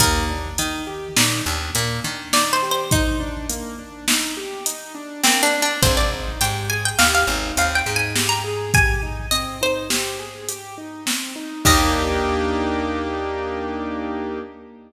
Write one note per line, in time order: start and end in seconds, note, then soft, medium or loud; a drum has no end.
0.00 0.49 D#2 medium
0.00 0.26 A#3 medium
0.00 2.08 A#4 medium
0.00 kick loud
0.00 closed hi-hat loud
0.29 0.56 D4 medium
0.58 1.08 D#3 medium
0.58 0.85 D#4 medium
0.58 closed hi-hat loud
0.87 1.13 G4 medium
1.16 1.42 A#2 medium
1.16 1.43 D#4 medium
1.16 snare loud
1.46 1.71 D#2 medium
1.46 1.72 D4 medium
1.74 2.00 A#2 medium
1.74 2.01 A#3 medium
1.74 closed hi-hat loud
2.04 5.26 D#3 medium
2.04 2.30 D4 medium
2.33 2.60 D#4 medium
2.33 2.52 D5 medium
2.33 snare loud
2.53 2.71 C5 medium
2.62 2.89 G4 medium
2.71 2.90 C5 medium
2.91 3.17 D#4 medium
2.91 4.94 D#4 medium
2.91 kick loud
2.91 closed hi-hat loud
3.20 3.46 D4 medium
3.49 3.76 A#3 medium
3.49 closed hi-hat loud
3.79 4.05 D4 medium
4.08 4.34 D#4 medium
4.08 snare loud
4.37 4.63 G4 medium
4.66 4.92 D#4 medium
4.66 closed hi-hat loud
4.95 5.21 D4 medium
5.24 5.50 A#3 medium
5.24 5.42 C4 medium
5.24 snare loud
5.43 5.61 D4 medium
5.53 5.79 D4 medium
5.62 5.81 D4 medium
5.82 6.32 G#1 medium
5.82 6.08 C4 medium
5.82 5.96 C5 loud
5.82 kick loud
5.82 closed hi-hat loud
5.97 6.11 D5 medium
6.12 6.39 D#4 medium
6.41 6.91 G#2 medium
6.41 6.67 G4 medium
6.41 6.66 G5 medium
6.41 closed hi-hat loud
6.70 6.96 G#4 medium
6.70 6.83 G#5 medium
6.85 6.99 G5 medium
6.99 7.24 D#2 medium
6.99 7.25 G4 medium
6.99 7.12 F5 medium
6.99 snare loud
7.15 7.55 F5 medium
7.27 7.52 G#1 medium
7.27 7.54 D#4 medium
7.57 7.82 D#2 medium
7.57 7.83 C4 medium
7.57 7.77 F5 medium
7.57 closed hi-hat loud
7.75 7.94 G5 medium
7.86 11.08 G#2 medium
7.86 8.13 D#4 medium
7.96 8.15 G#5 medium
8.16 8.42 G4 medium
8.16 snare loud
8.29 8.43 A#5 medium
8.44 8.70 G#4 medium
8.74 9.00 G4 medium
8.74 9.30 G#5 medium
8.74 kick loud
8.74 closed hi-hat loud
9.03 9.29 D#4 medium
9.31 9.58 C4 medium
9.31 9.55 D#5 medium
9.31 closed hi-hat loud
9.61 9.87 D#4 medium
9.61 10.37 C5 medium
9.90 10.16 G4 medium
9.90 snare loud
10.19 10.46 G#4 medium
10.49 10.75 G4 medium
10.49 closed hi-hat loud
10.78 11.04 D#4 medium
11.06 11.32 C4 medium
11.06 snare loud
11.36 11.62 D#4 medium
11.65 14.39 D#2 loud
11.65 14.39 A#3 loud
11.65 14.39 D4 medium
11.65 14.39 D#4 loud
11.65 14.39 G4 loud
11.65 14.40 D#5 loud
11.65 kick loud
11.65 crash loud